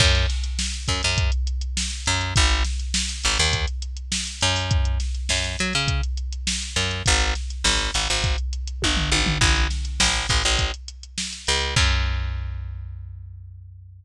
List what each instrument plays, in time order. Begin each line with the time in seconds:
0.00 electric bass (finger) F#2, kick, crash
0.15 snare, closed hi-hat
0.30 snare, closed hi-hat
0.44 closed hi-hat
0.59 snare
0.74 closed hi-hat
0.88 electric bass (finger) F#2, kick, closed hi-hat
1.03 electric bass (finger) F#2, closed hi-hat
1.18 kick, closed hi-hat
1.32 closed hi-hat
1.47 closed hi-hat
1.61 closed hi-hat
1.77 snare
1.91 snare, closed hi-hat
2.06 electric bass (finger) F#2, closed hi-hat
2.21 closed hi-hat
2.36 electric bass (finger) G#1, kick, closed hi-hat
2.50 closed hi-hat
2.64 snare, closed hi-hat
2.80 closed hi-hat
2.94 snare
3.09 closed hi-hat
3.24 electric bass (finger) G#1, closed hi-hat
3.38 electric bass (finger) D#2, snare, closed hi-hat
3.53 kick, closed hi-hat
3.68 closed hi-hat
3.82 closed hi-hat
3.97 closed hi-hat
4.12 snare
4.27 closed hi-hat
4.41 electric bass (finger) F#2, closed hi-hat
4.56 open hi-hat
4.71 kick, closed hi-hat
4.85 closed hi-hat
5.00 snare, closed hi-hat
5.15 closed hi-hat
5.29 electric bass (finger) F#2, snare
5.44 closed hi-hat
5.59 electric bass (finger) F#3, closed hi-hat
5.73 electric bass (finger) C#3, snare, closed hi-hat
5.88 kick, closed hi-hat
6.03 closed hi-hat
6.17 closed hi-hat
6.32 closed hi-hat
6.47 snare
6.62 closed hi-hat
6.76 electric bass (finger) F#2, snare, closed hi-hat
6.91 closed hi-hat
7.06 electric bass (finger) G#1, kick, closed hi-hat
7.21 closed hi-hat
7.35 snare, closed hi-hat
7.50 closed hi-hat
7.64 electric bass (finger) G#1, snare
7.79 closed hi-hat
7.94 electric bass (finger) G#1, closed hi-hat
8.09 electric bass (finger) G#1, closed hi-hat
8.24 kick, closed hi-hat
8.38 closed hi-hat
8.53 closed hi-hat
8.68 closed hi-hat
8.82 electric bass (finger) G1, kick, high tom
8.97 floor tom
9.12 electric bass (finger) G#1, high tom
9.26 floor tom
9.41 electric bass (finger) A1, kick, crash
9.56 closed hi-hat
9.70 snare, closed hi-hat
9.85 closed hi-hat
10.00 electric bass (finger) A1, snare
10.15 closed hi-hat
10.29 electric bass (finger) A1, kick, closed hi-hat
10.44 electric bass (finger) A1, closed hi-hat
10.59 kick, closed hi-hat
10.74 closed hi-hat
10.88 closed hi-hat
11.03 closed hi-hat
11.18 snare
11.33 closed hi-hat
11.47 electric bass (finger) C#2, closed hi-hat
11.61 closed hi-hat
11.76 electric bass (finger) F#2, kick, crash